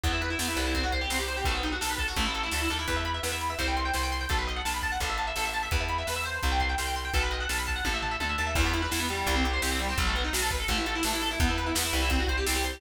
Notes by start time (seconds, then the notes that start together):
0.04 E2 B3, kick, closed hi-hat
0.13 E4
0.21 B4, closed hi-hat
0.30 E4
0.39 E2 B3, snare
0.48 E4
0.57 C2 B4, closed hi-hat
0.66 E4
0.75 C4, kick, closed hi-hat
0.84 F#4
0.92 C5, kick, closed hi-hat
1.01 G4
1.10 C2 C4, snare
1.19 G4
1.28 C5, closed hi-hat
1.37 G4
1.45 B1 A3, kick, closed hi-hat
1.55 B3
1.63 D#4, closed hi-hat
1.72 F#4
1.81 B1 A4, snare
1.90 B4
1.98 A4, kick, closed hi-hat
2.08 F#4
2.16 A1 A3, kick, closed hi-hat
2.26 E4
2.34 A4, closed hi-hat
2.43 E4
2.51 D2 A3, snare
2.61 E4
2.69 D#2 A4, closed hi-hat
2.79 E4
2.88 E2 B4, kick, closed hi-hat
2.97 E5
3.05 B5, closed hi-hat
3.14 E5
3.23 E2 B4, snare
3.32 E5
3.41 B5, closed hi-hat
3.50 E5
3.59 C2 C5, kick, closed hi-hat
3.68 G5
3.76 C6, closed hi-hat
3.85 G5
3.94 C2 C5, snare
4.03 G5
4.12 C6, closed hi-hat
4.21 G5
4.29 B1 A4, kick, closed hi-hat
4.39 B4
4.47 D#5, closed hi-hat
4.56 F#5
4.65 B1 A5, snare
4.74 B5
4.82 A5, kick, closed hi-hat
4.92 F#5
5.00 A1 A4, kick, closed hi-hat
5.10 E5
5.18 A5, closed hi-hat
5.27 E5
5.36 A1 A4, snare
5.45 E5
5.53 A5, closed hi-hat
5.63 E5
5.71 E2 B4, kick, closed hi-hat
5.81 E5
5.89 B5, closed hi-hat
5.98 E5
6.07 E2 B4, snare
6.16 E5
6.24 C5, closed hi-hat
6.43 C2, kick, closed hi-hat
6.52 G5
6.60 C6, kick, closed hi-hat
6.69 G5
6.78 C2 C5, snare
6.87 G5
6.95 C6, closed hi-hat
7.05 G5
7.14 B1 A4, kick, closed hi-hat
7.23 B4
7.31 D#5, closed hi-hat
7.40 F#5
7.49 B1 A5, snare
7.58 B5
7.67 A5, kick, closed hi-hat
7.76 F#5
7.85 A1 A4, kick, high tom
7.94 E5
8.02 A5, floor tom
8.11 E5
8.20 D2 A4, high tom
8.29 E5
8.38 D#2 A5
8.47 E5
8.55 E2 E3, kick, crash
8.65 B3
8.73 E4, closed hi-hat
8.82 B4
8.91 E2 E4, snare
9.00 B3
9.09 G3, closed hi-hat
9.27 C2, kick, closed hi-hat
9.36 C4
9.44 G4, closed hi-hat
9.53 C5
9.62 C2 G4, snare
9.71 C4
9.79 G3, closed hi-hat
9.89 C4
9.98 B1 F#3, kick, closed hi-hat
10.07 A3
10.15 B3, closed hi-hat
10.24 D#4
10.33 B1 F#4, snare
10.42 A4
10.50 B4, kick, closed hi-hat
10.60 A4
10.68 A1 A3, kick, closed hi-hat
10.78 E4
10.86 A4, closed hi-hat
10.95 E4
11.03 A1 A3, snare
11.13 E4
11.21 A4, open hi-hat
11.31 E4
11.40 E2 B3, kick, closed hi-hat
11.49 E4
11.57 B4, closed hi-hat
11.66 E4
11.75 E2 B3, snare
11.84 E4
11.93 C2 B4, closed hi-hat
12.02 E4
12.10 C4, kick, closed hi-hat
12.20 F#4
12.27 C5, kick, closed hi-hat
12.37 G4
12.46 C2 C4, snare
12.55 G4
12.64 C5, closed hi-hat
12.73 G4